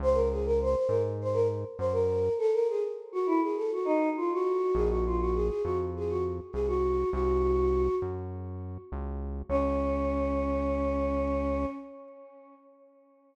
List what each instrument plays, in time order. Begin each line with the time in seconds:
0.00 synth bass 1 C#2, choir aahs C5
0.14 choir aahs A#4
0.31 choir aahs G#4
0.45 choir aahs A#4
0.62 choir aahs C5
0.76 choir aahs C5
0.88 synth bass 1 G#2, choir aahs A#4
1.21 choir aahs C5
1.33 choir aahs A#4
1.78 synth bass 1 F#2, choir aahs C5
1.92 choir aahs A#4
2.38 choir aahs A4
2.53 choir aahs A#4
2.68 choir aahs G#4
3.12 choir aahs F#4
3.26 choir aahs E4
3.41 choir aahs G#4
3.56 choir aahs A4
3.72 choir aahs F#4
3.85 choir aahs D#4
4.17 choir aahs F4
4.33 choir aahs F#4
4.74 synth bass 1 A#1, choir aahs G#4
4.89 choir aahs F#4
5.06 choir aahs F4
5.20 choir aahs F#4
5.34 choir aahs G#4
5.48 choir aahs G#4
5.63 synth bass 1 F2, choir aahs F#4
5.96 choir aahs G#4
6.09 choir aahs F#4
6.52 synth bass 1 C2, choir aahs G#4
6.67 choir aahs F#4
7.11 synth bass 1 C2, choir aahs F#4
8.02 synth bass 1 F#2
8.92 synth bass 1 C#2
9.49 synth bass 1 C#2, choir aahs C#4